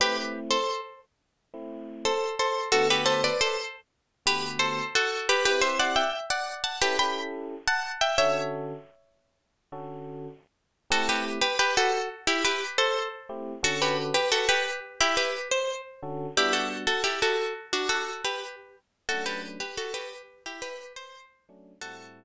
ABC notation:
X:1
M:4/4
L:1/16
Q:1/4=88
K:Ador
V:1 name="Acoustic Guitar (steel)"
[GB] z2 [Ac]2 z7 [Ac]2 [Ac]2 | [FA] [GB] [Ac] [Bd] [Ac] z4 [GB]2 [Ac]2 [FA]2 [GB] | [GB] [ce] [df] [eg] z [df]2 [fa] [GB] [gb]2 z2 [fa]2 [eg] | [^ce]8 z8 |
[FA] [GB] z [GB] [GB] [FA]2 z [EG] [GB]2 [Ac]2 z3 | [FA] [GB] z [GB] [FA] [GB]2 z [EG] [GB]2 c2 z3 | [EG] [FA] z [FA] [EG] [FA]2 z [DF] [FA]2 [GB]2 z3 | [FA] [GB] z [GB] [FA] [GB]2 z [EG] [GB]2 c2 z3 |
[FA]6 z10 |]
V:2 name="Electric Piano 1"
[A,CE]9 [A,CE]7 | [D,A,B,F]9 [D,A,B,F]7 | [CEG]8 [^CEGA] [CEGA]7 | [D,^CFA]9 [D,CFA]7 |
[A,CEG]14 [A,CEG]2 | [D,^CFA]14 [D,CFA]2 | [G,B,DF]16 | [F,A,^CD]14 [F,A,CD]2 |
[A,,G,CE]6 z10 |]